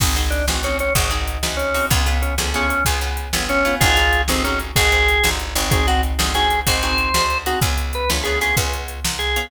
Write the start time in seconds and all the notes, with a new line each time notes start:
0.00 G#1 C4 D#4 F#4 G#4, kick, crash
0.16 C4 D#4 F#4 G#4, closed hi-hat
0.30 D4, closed hi-hat
0.47 A1 C4 D#4 F#4 G#4, snare
0.63 C4 C#4 D#4 F#4 G#4, closed hi-hat
0.79 C#4, closed hi-hat
0.95 G#1 C4 D#4 F#4 G#4, kick, closed hi-hat
1.11 C4 D#4 F#4 G#4, closed hi-hat
1.28 closed hi-hat
1.43 D2 C4 D#4 F#4 G#4, snare
1.57 C#4, closed hi-hat
1.74 C4 D#4 F#4 G#4, open hi-hat
1.90 C#2 B3 C#4 F4 G#4, kick, closed hi-hat
2.06 B3 C#4 F4 G#4, closed hi-hat
2.22 C#4, closed hi-hat
2.38 D2 B3 C#4 F4 G#4, snare
2.54 B3 C#4 F4 G#4, closed hi-hat
2.69 C#4, closed hi-hat
2.85 C#2 B3 C#4 F4 G#4, kick, closed hi-hat
3.01 B3 C#4 F4 G#4, closed hi-hat
3.17 closed hi-hat
3.33 G1 B3 C#4 F4 G#4, snare
3.49 C#4, closed hi-hat
3.65 B3 C#4 F4 G#4, closed hi-hat
3.80 G#1 C4 D#4 F4 F#4 G#4, kick, closed hi-hat
3.96 C4 D#4 F#4 G#4, closed hi-hat
4.13 closed hi-hat
4.28 G1 C4 D#4 F#4 G#4, snare
4.44 C4 C#4 D#4 F#4 G#4, closed hi-hat
4.59 closed hi-hat
4.76 G#1 C4 D#4 F#4 G#4, kick, closed hi-hat
4.92 C4 D#4 F#4 G#4, closed hi-hat
5.08 closed hi-hat
5.24 G1 C4 D#4 F#4 G#4, snare
5.39 closed hi-hat
5.55 G#1 C4 D#4 F#4 G#4, closed hi-hat
5.71 C4 D#4 F#4 G#4, kick, closed hi-hat
5.87 C4 D#4 F#4 G#4, closed hi-hat
6.03 closed hi-hat
6.19 G1 C4 D#4 F#4 G#4, snare
6.34 C4 D#4 F#4 G#4, closed hi-hat
6.50 closed hi-hat
6.67 G#1 C4 D#4 F#4 G#4 C5, kick, closed hi-hat
6.82 C4 D#4 F#4 G#4, closed hi-hat
6.98 closed hi-hat
7.14 D2 C4 D#4 F#4 G#4, snare
7.30 closed hi-hat
7.46 C4 D#4 F#4 G#4, closed hi-hat
7.61 C#2 B3 C#4 F4 G#4, kick, closed hi-hat
7.78 closed hi-hat
7.93 B4, closed hi-hat
8.10 D2 B3 C#4 F4 G#4, snare
8.23 B3 C#4 F4 G#4, closed hi-hat
8.41 B3 C#4 F4 G#4, closed hi-hat
8.57 C#2 B3 C#4 F4 G#4, kick, closed hi-hat
8.73 closed hi-hat
8.88 closed hi-hat
9.05 C2, snare
9.19 G#4, closed hi-hat
9.36 B3 C#4 F4 G#4, closed hi-hat